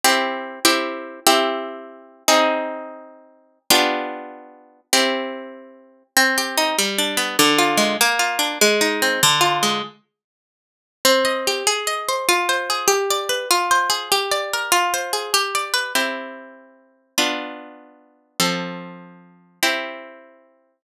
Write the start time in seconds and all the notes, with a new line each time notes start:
0.04 C4 E4 G4
0.65 C4 E4 G4
1.27 C4 E4 G4
2.28 C4 D#4 G#4
3.70 B3 D4 F4 G4
4.93 C4 E4 G4
6.17 C4
6.38 G4
6.57 D#4
6.78 G3
6.98 D4
7.17 B3
7.39 D3
7.59 F4
7.77 G#3
8.01 A#3
8.19 F4
8.39 D4
8.61 G#3
8.81 D#4
9.02 C4
9.23 D3
9.41 F4
9.63 G#3
11.05 C4
11.25 D#5
11.47 G4
11.67 G#4
11.87 D#5
12.09 C5
12.29 F4
12.49 C5
12.70 G#4
12.88 G4
13.10 D5
13.29 B4
13.51 F4
13.71 C5
13.90 G#4
14.12 G4
14.31 D5
14.53 A#4
14.72 F4
14.94 C5
15.13 G#4
15.34 G4
15.55 D5
15.74 B4
15.95 C4 E4 G4
17.18 B3 D4 F4
18.40 F3 C4 A4
19.63 C4 E4 G4